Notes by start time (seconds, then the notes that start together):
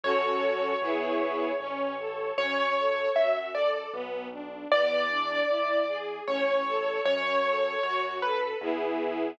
0.03 F#2 C#4 F#4 A4 C#5
0.81 E2 B3 E4 G#4
1.60 A1 C#4
1.99 A4
2.38 F#2 C#4 C#5
2.77 A4
3.15 F#2 F#4 E5
3.54 A4 D5
3.93 B1 B3
4.32 D4
4.72 E2 B3 D5
5.10 D4
5.49 E2 E4
5.88 G#4
6.27 A1 C#4 C#5
6.66 A4
7.05 F#2 C#4 C#5
7.44 A4
7.82 F#2 F#4 C#5
8.21 A4 B4
8.61 E2 B3 E4 G#4